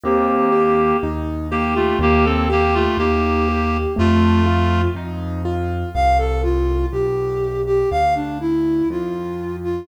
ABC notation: X:1
M:2/4
L:1/16
Q:1/4=61
K:Bb
V:1 name="Clarinet"
[B,G]4 z2 [B,G] [A,F] | [B,G] [CA] [B,G] [A,F] [B,G]4 | [A,F]4 z4 | [K:C] z8 |
z8 |]
V:2 name="Flute"
z8 | z8 | z8 | [K:C] f A F2 G3 G |
f D E2 F3 F |]
V:3 name="Acoustic Grand Piano"
C2 G2 E2 G2 | B,2 G2 E2 G2 | A,2 F2 E2 F2 | [K:C] z8 |
z8 |]
V:4 name="Acoustic Grand Piano" clef=bass
E,,4 E,,4 | E,,4 E,,4 | F,,4 F,,4 | [K:C] C,,4 B,,,4 |
D,,4 F,,4 |]